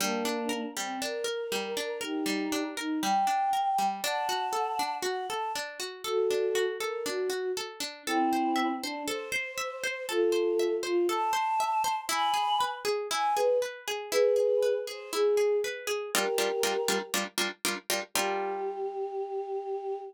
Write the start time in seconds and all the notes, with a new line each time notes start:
0.00 G3 A#3 D4
0.25 D4
0.49 A#4
0.76 G3 C4
1.01 D4 A#4
1.24 A#4
1.52 G3
1.77 D4
2.01 D#4 G4 A#4
2.26 G3
2.52 D4
2.77 D#4 A#4
3.03 G3 G5
3.27 D4
3.53 A#4
3.78 G3
4.04 D4 F#5 A5
4.29 F#4
4.53 A4
4.79 D4
5.03 F#4 F#5
5.30 A4 A5
5.55 D4
5.80 F#4
6.04 F#4 A4
6.30 D4
6.55 F#4
6.80 A4 A#4
7.06 D4 F#4
7.30 F#4
7.57 A4
7.80 D4
8.06 C4 E4 A4
8.33 C5
8.56 E5
8.82 D4 C5
9.07 A4 C5
9.32 C5
9.58 E5
9.84 C5
10.09 F4 A4
10.32 C5
10.59 E5
10.83 F4 C5
11.09 A4 A5
11.33 C5
11.60 E5
11.84 C5
12.09 E4 G#5 B5
12.34 G#4
12.61 B4
12.85 G#4
13.11 E4 G#5
13.36 G#4 B4
13.62 B4
13.88 G#4
14.11 E4 G#4 B4
14.36 G#4
14.63 B4
14.87 G#4 C5
15.12 E4 G#4
15.37 G#4
15.64 B4
15.87 G#4
16.14 G3 D4 F4 G4 A#4
16.38 G3 D4 F4 A#4
16.63 G3 D4 F4 A#4
16.88 G3 D4 F4 A#4
17.14 G3 D4 F4 A#4
17.38 G3 D4 F4 A#4
17.65 G3 D4 F4 A#4
17.90 G3 D4 F4 A#4
18.14 G3 D4 F4 G4 A#4